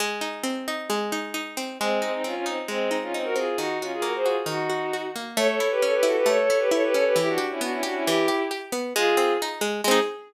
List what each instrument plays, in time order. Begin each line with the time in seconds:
0.00 pizzicato strings G#3
0.21 pizzicato strings D#4
0.43 pizzicato strings C4
0.68 pizzicato strings D#4
0.90 pizzicato strings G#3
1.12 pizzicato strings D#4
1.34 pizzicato strings D#4
1.57 pizzicato strings C4
1.79 violin G#3 C4, pizzicato strings G#3
2.02 violin G#3 C4, pizzicato strings D#4
2.12 violin C4 D#4
2.24 pizzicato strings C4, violin C#4 F4
2.34 violin C#4 F4
2.46 violin C4 D#4, pizzicato strings D#4
2.68 violin G#3 C4, pizzicato strings G#3
2.91 pizzicato strings D#4
3.02 violin C#4 F4
3.13 violin C4 D#4, pizzicato strings D#4
3.24 violin F#4 A#4
3.36 pizzicato strings C4, violin F4 G#4
3.57 pizzicato strings D#3, violin D#4 F#4
3.81 violin C#4 F4, pizzicato strings F#4
3.93 violin F4 G#4
4.02 pizzicato strings A#3, violin F#4 A#4
4.15 violin G#4 C5
4.25 violin F4 G#4, pizzicato strings F#4
4.46 pizzicato strings D#3, violin D#4 F#4
4.70 pizzicato strings F#4
4.93 pizzicato strings F#4
5.16 pizzicato strings A#3
5.37 pizzicato strings A3, violin A4 C#5
5.48 violin A4 C#5
5.60 pizzicato strings E4
5.71 violin G4 B4
5.82 pizzicato strings C#4, violin A4 C#5
5.94 violin G4 B4
6.03 pizzicato strings E4, violin F#4 A4
6.17 violin G4 B4
6.26 pizzicato strings A3, violin A4 C#5
6.39 violin A4 C#5
6.50 pizzicato strings E4
6.59 violin G4 B4
6.71 pizzicato strings E4, violin A4 C#5
6.83 violin G4 B4
6.94 pizzicato strings C#4, violin A4 C#5
7.05 violin G4 B4
7.16 pizzicato strings E3, violin E4 G4
7.28 violin D4 F#4
7.38 pizzicato strings G4
7.50 violin C#4 E4
7.61 pizzicato strings B3, violin D4 F#4
7.71 violin C#4 E4
7.83 violin D4 F#4, pizzicato strings G4
7.94 violin C#4 E4
8.05 pizzicato strings E3, violin E4 G4
8.28 pizzicato strings G4
8.51 pizzicato strings G4
8.72 pizzicato strings B3
8.95 pizzicato strings G#3, violin F4 G#4
9.17 pizzicato strings C4
9.42 pizzicato strings D#4
9.61 pizzicato strings G#3
9.84 pizzicato strings G#3 C4, violin G#4
9.91 pizzicato strings D#4